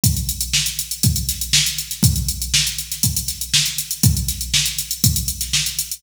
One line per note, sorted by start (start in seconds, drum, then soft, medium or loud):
0.04 kick loud
0.04 closed hi-hat loud
0.17 closed hi-hat medium
0.29 closed hi-hat medium
0.41 closed hi-hat medium
0.53 snare loud
0.66 closed hi-hat medium
0.79 closed hi-hat medium
0.91 closed hi-hat medium
1.03 kick loud
1.03 closed hi-hat loud
1.16 closed hi-hat medium
1.29 snare soft
1.29 closed hi-hat medium
1.41 closed hi-hat medium
1.53 snare loud
1.66 snare soft
1.66 closed hi-hat medium
1.78 closed hi-hat medium
1.91 snare soft
1.91 closed hi-hat medium
2.03 kick loud
2.03 closed hi-hat loud
2.16 closed hi-hat medium
2.29 closed hi-hat medium
2.42 closed hi-hat medium
2.54 snare loud
2.67 closed hi-hat medium
2.78 closed hi-hat medium
2.92 snare soft
2.92 closed hi-hat medium
3.03 kick medium
3.03 closed hi-hat loud
3.17 closed hi-hat medium
3.28 snare soft
3.28 closed hi-hat medium
3.41 closed hi-hat medium
3.54 snare loud
3.66 closed hi-hat medium
3.78 closed hi-hat medium
3.91 closed hi-hat medium
4.03 kick loud
4.03 closed hi-hat loud
4.17 closed hi-hat medium
4.28 snare soft
4.28 closed hi-hat medium
4.41 closed hi-hat medium
4.54 snare loud
4.66 closed hi-hat medium
4.79 closed hi-hat medium
4.91 closed hi-hat medium
5.04 kick loud
5.04 closed hi-hat loud
5.16 closed hi-hat medium
5.28 closed hi-hat medium
5.41 snare soft
5.41 closed hi-hat medium
5.53 snare loud
5.66 closed hi-hat medium
5.79 closed hi-hat medium
5.92 closed hi-hat medium